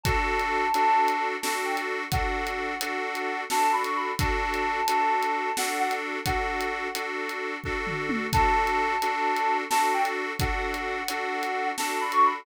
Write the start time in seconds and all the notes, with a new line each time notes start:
0.03 D4 F#4 A4 A5, kick, closed hi-hat
0.39 closed hi-hat
0.74 D4 F#4 A4, closed hi-hat
1.08 closed hi-hat
1.41 D4 F#4 A4 A5, snare
1.65 G5
1.77 closed hi-hat
2.11 D4 F#4 A4 F#5, kick, closed hi-hat
2.47 closed hi-hat
2.81 D4 F#4 A4, closed hi-hat
3.15 closed hi-hat
3.50 D4 F#4 A4 A5, snare
3.72 B5
3.84 C#6, closed hi-hat
3.96 B5
4.19 D4 F#4 A4 A5, kick, closed hi-hat
4.54 closed hi-hat
4.88 D4 F#4 A4, closed hi-hat
5.23 closed hi-hat
5.57 D4 F#4 A4 F#5, snare
5.79 F#5
5.91 closed hi-hat
6.26 D4 F#4 A4 F#5, kick, closed hi-hat
6.61 closed hi-hat
6.95 D4 F#4 A4, closed hi-hat
7.29 closed hi-hat
7.64 D4 F#4 A4, kick
7.87 floor tom
8.09 mid tom
8.33 D4 F#4 A4 A5, kick, closed hi-hat
8.67 closed hi-hat
9.02 D4 F#4 A4, closed hi-hat
9.36 closed hi-hat
9.70 D4 F#4 A4 A5, snare
9.93 G5
10.05 closed hi-hat
10.39 D4 F#4 A4 F#5, kick, closed hi-hat
10.74 closed hi-hat
11.08 D4 F#4 A4, closed hi-hat
11.43 closed hi-hat
11.77 D4 F#4 A4 A5, snare
12.00 B5
12.12 C#6, closed hi-hat
12.24 B5